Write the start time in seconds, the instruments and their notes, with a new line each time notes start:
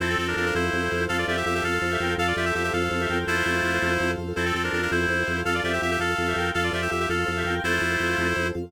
0.00 drawbar organ F2, clarinet C4 E4 A4 C5, pad 5 (bowed) C4 F4 A4, acoustic grand piano A4
0.09 clarinet C4 A4
0.16 drawbar organ F2, clarinet C4 A4, acoustic grand piano C5
0.27 clarinet D4 A#4
0.36 drawbar organ F2, clarinet D4 A#4, acoustic grand piano F5
0.46 clarinet D4 A#4
0.53 drawbar organ F2, clarinet E4 C5, acoustic grand piano A4
0.73 drawbar organ F2, acoustic grand piano C5
0.91 drawbar organ F2, acoustic grand piano F5
1.09 drawbar organ F2, clarinet A4 F5, acoustic grand piano A4
1.18 clarinet F4 D5
1.26 drawbar organ F2, clarinet F4 G4 D5 E5, acoustic grand piano C5
1.37 clarinet G4 E5
1.46 drawbar organ F2, clarinet G4 E5, acoustic grand piano F5
1.55 clarinet G4 E5
1.62 drawbar organ F2, acoustic grand piano A4, clarinet A4 F5
1.82 drawbar organ F2, acoustic grand piano C5
1.91 clarinet G4 E5
2.00 drawbar organ F2, clarinet A#4 G5, acoustic grand piano F5
2.18 drawbar organ F2, pad 5 (bowed) C4 F4 A4, clarinet A4 F5, acoustic grand piano A4
2.27 clarinet F4 D5
2.36 drawbar organ F2, clarinet F4 G4 D5 E5, acoustic grand piano C5
2.45 clarinet G4 E5
2.55 drawbar organ F2, clarinet G4 E5, acoustic grand piano F5
2.64 clarinet G4 E5
2.73 drawbar organ F2, clarinet A4 F5, acoustic grand piano A4
2.91 drawbar organ F2, acoustic grand piano C5
3.00 clarinet G4 E5
3.09 drawbar organ F2, clarinet A#4 G5, acoustic grand piano F5
3.27 drawbar organ F2, clarinet A3 E4 F4 C5, acoustic grand piano A4
3.46 drawbar organ F2, acoustic grand piano C5
3.63 drawbar organ F2, acoustic grand piano F5
3.82 drawbar organ F2, acoustic grand piano A4
3.99 drawbar organ F2, acoustic grand piano C5
4.18 drawbar organ F2, acoustic grand piano F5
4.36 drawbar organ F2, clarinet C4 E4 A4 C5, pad 5 (bowed) C4 F4 A4, acoustic grand piano A4
4.46 clarinet C4 A4
4.54 drawbar organ F2, clarinet C4 A4, acoustic grand piano C5
4.64 clarinet D4 A#4
4.73 drawbar organ F2, clarinet D4 A#4, acoustic grand piano F5
4.82 clarinet D4 A#4
4.91 drawbar organ F2, clarinet E4 C5, acoustic grand piano A4
5.08 drawbar organ F2, acoustic grand piano C5
5.26 drawbar organ F2, acoustic grand piano F5
5.45 drawbar organ F2, acoustic grand piano A4, clarinet A4 F5
5.54 clarinet F4 D5
5.63 drawbar organ F2, clarinet F4 G4 D5 E5, acoustic grand piano C5
5.73 clarinet G4 E5
5.82 drawbar organ F2, clarinet G4 E5, acoustic grand piano F5
5.91 clarinet G4 E5
5.99 drawbar organ F2, acoustic grand piano A4, clarinet A4 F5
6.17 drawbar organ F2, acoustic grand piano C5
6.27 clarinet G4 E5
6.36 drawbar organ F2, clarinet A#4 G5, acoustic grand piano F5
6.54 drawbar organ F2, pad 5 (bowed) C4 F4 A4, acoustic grand piano A4, clarinet A4 F5
6.64 clarinet F4 D5
6.72 drawbar organ F2, clarinet F4 G4 D5 E5, acoustic grand piano C5
6.82 clarinet G4 E5
6.90 drawbar organ F2, clarinet G4 E5, acoustic grand piano F5
7.00 clarinet G4 E5
7.09 drawbar organ F2, clarinet A4 F5, acoustic grand piano A4
7.26 drawbar organ F2, acoustic grand piano C5
7.36 clarinet G4 E5
7.45 drawbar organ F2, clarinet A#4 G5, acoustic grand piano F5
7.64 drawbar organ F2, clarinet A3 E4 F4 C5, acoustic grand piano A4
7.81 drawbar organ F2, acoustic grand piano C5
8.00 drawbar organ F2, acoustic grand piano F5
8.18 drawbar organ F2, acoustic grand piano A4
8.36 drawbar organ F2, acoustic grand piano C5
8.55 drawbar organ F2, acoustic grand piano F5